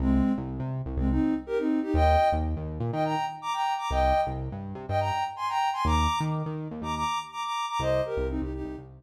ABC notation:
X:1
M:4/4
L:1/16
Q:1/4=123
K:Cm
V:1 name="Ocarina"
[A,C]3 z5 [A,C] [CE]2 z [GB] [CE]2 [EG] | [eg]3 z5 [eg] [gb]2 z [bd'] [gb]2 [bd'] | [eg]3 z5 [eg] [gb]2 z [ac'] [gb]2 [ac'] | [bd']3 z5 [bd'] [bd']2 z [bd'] [bd']2 [bd'] |
[ce]2 [GB]2 [CE] [EG] [EG]2 z8 |]
V:2 name="Synth Bass 1" clef=bass
C,,3 C,,2 C,2 C,, C,,8 | E,,3 E,,2 E,,2 B,, E,8 | C,,3 C,,2 G,,2 C, G,,8 | E,,3 E,2 E,2 E,, E,,8 |
C,,3 C,,2 C,,2 C,, C,,8 |]